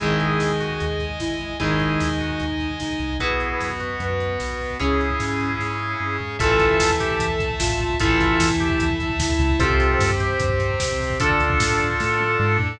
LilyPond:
<<
  \new Staff \with { instrumentName = "Drawbar Organ" } { \time 4/4 \key gis \minor \tempo 4 = 150 <e' gis'>4. fis'8. r4. r16 | <e' gis'>4. fis'8. r4. r16 | <e' gis'>4. fis'8. r4. r16 | <e' gis'>2.~ <e' gis'>8 r8 |
\key a \minor <f' a'>4. g'8. r4. r16 | <f' a'>4. g'8. r4. r16 | <f' a'>4. g'8. r4. r16 | <f' a'>2.~ <f' a'>8 r8 | }
  \new Staff \with { instrumentName = "Ocarina" } { \time 4/4 \key gis \minor gis'2. e'4 | dis'2. dis'4 | b'4 b'4 b'2 | cis'2 r2 |
\key a \minor a'2. f'4 | e'2. e'4 | c''4 c''4 c''2 | d'2 r2 | }
  \new Staff \with { instrumentName = "Overdriven Guitar" } { \time 4/4 \key gis \minor <dis gis>1 | <dis gis>1 | <fis' b'>1 | <gis' cis''>1 |
\key a \minor <e a>1 | <e a>1 | <g' c''>1 | <a' d''>1 | }
  \new Staff \with { instrumentName = "Drawbar Organ" } { \time 4/4 \key gis \minor <dis'' gis''>1 | <dis'' gis''>1 | <b fis'>1 | <cis' gis'>1 |
\key a \minor <e'' a''>1 | <e'' a''>1 | <c' g'>1 | <d' a'>1 | }
  \new Staff \with { instrumentName = "Synth Bass 1" } { \clef bass \time 4/4 \key gis \minor gis,,4 dis,4 dis,4 gis,,4 | gis,,4 dis,4 dis,4 cis,8 c,8 | b,,4 fis,4 fis,4 b,,4 | cis,4 gis,4 gis,4 g,8 gis,8 |
\key a \minor a,,4 e,4 e,4 a,,4 | a,,4 e,4 e,4 d,8 des,8 | c,4 g,4 g,4 c,4 | d,4 a,4 a,4 gis,8 a,8 | }
  \new Staff \with { instrumentName = "String Ensemble 1" } { \time 4/4 \key gis \minor <dis'' gis''>1 | <dis'' gis''>1 | <b fis'>1 | <cis' gis'>1 |
\key a \minor <e'' a''>1 | <e'' a''>1 | <c' g'>1 | <d' a'>1 | }
  \new DrumStaff \with { instrumentName = "Drums" } \drummode { \time 4/4 <hh bd>16 bd16 <hh bd>16 bd16 <bd sn>16 bd16 <hh bd>16 bd16 <hh bd>16 bd16 <hh bd>16 bd16 <bd sn>16 bd16 <hh bd>16 bd16 | <hh bd>16 bd16 <hh bd>16 bd16 <bd sn>16 bd16 <hh bd>16 bd16 <hh bd>16 bd16 <hh bd>16 bd16 <bd sn>16 bd16 <hh bd>16 bd16 | <hh bd>16 bd16 <hh bd>16 bd16 <bd sn>16 bd16 <hh bd>16 bd16 <hh bd>16 bd16 <hh bd>16 bd16 <bd sn>16 bd16 <hho bd>16 bd16 | <hh bd>16 bd16 <hh bd>16 bd16 <bd sn>16 bd16 <hh bd>16 bd16 <bd sn>8 tommh8 r8 tomfh8 |
<hh bd>16 bd16 <hh bd>16 bd16 <bd sn>16 bd16 <hh bd>16 bd16 <hh bd>16 bd16 <hh bd>16 bd16 <bd sn>16 bd16 <hh bd>16 bd16 | <hh bd>16 bd16 <hh bd>16 bd16 <bd sn>16 bd16 <hh bd>16 bd16 <hh bd>16 bd16 <hh bd>16 bd16 <bd sn>16 bd16 <hh bd>16 bd16 | <hh bd>16 bd16 <hh bd>16 bd16 <bd sn>16 bd16 <hh bd>16 bd16 <hh bd>16 bd16 <hh bd>16 bd16 <bd sn>16 bd16 <hho bd>16 bd16 | <hh bd>16 bd16 <hh bd>16 bd16 <bd sn>16 bd16 <hh bd>16 bd16 <bd sn>8 tommh8 r8 tomfh8 | }
>>